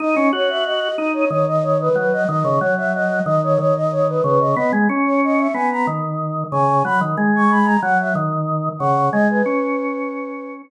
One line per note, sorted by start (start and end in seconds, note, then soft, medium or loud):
0.00 0.15 D#4 medium
0.00 0.29 D#5 loud
0.16 0.32 C#4 medium
0.33 0.89 F#4 medium
0.33 0.49 C#5 medium
0.49 0.65 E5 loud
0.65 0.96 D#5 loud
0.96 1.25 D#4 medium
0.96 1.12 D#5 loud
1.13 1.29 C#5 medium
1.30 1.89 D#3 medium
1.30 1.46 C#5 medium
1.48 1.63 D#5 loud
1.63 1.78 C#5 medium
1.80 1.96 B4 loud
1.95 2.24 F#3 medium
1.95 2.12 B4 medium
2.13 2.27 D#5 loud
2.28 2.44 D#3 medium
2.28 2.59 D#5 loud
2.45 2.60 C#3 medium
2.59 3.20 F#3 medium
2.59 2.74 C#5 medium
2.77 2.93 E5 medium
2.94 3.22 D#5 loud
3.25 3.58 D#3 medium
3.25 3.41 D#5 loud
3.43 3.58 C#5 loud
3.59 4.21 D#3 medium
3.59 3.74 C#5 loud
3.76 3.91 D#5 loud
3.91 4.07 C#5 loud
4.08 4.23 B4 medium
4.23 4.55 C#3 medium
4.23 4.39 B4 medium
4.40 4.55 D#5 medium
4.56 4.72 B3 medium
4.56 4.71 D#5 loud
4.73 4.88 G#3 medium
4.89 5.48 C#4 medium
5.05 5.21 C#5 medium
5.24 5.39 D#5 medium
5.38 5.54 E5 medium
5.54 5.86 B3 medium
5.54 5.69 G#5 medium
5.71 5.87 A#5 medium
5.87 6.44 D#3 medium
6.52 6.83 C#3 medium
6.52 6.82 G#5 medium
6.85 7.00 F#3 medium
6.85 7.00 B5 loud
7.01 7.16 D#3 medium
7.17 7.77 G#3 medium
7.36 7.51 C#6 medium
7.50 7.66 B5 loud
7.65 7.80 A#5 loud
7.82 8.14 F#3 medium
7.82 7.98 F#5 loud
7.99 8.15 E5 medium
8.15 8.69 D#3 medium
8.79 9.10 C#3 medium
8.79 9.09 F#5 loud
9.12 9.42 G#3 medium
9.12 9.28 D#5 loud
9.30 10.53 B4 medium
9.46 10.62 C#4 medium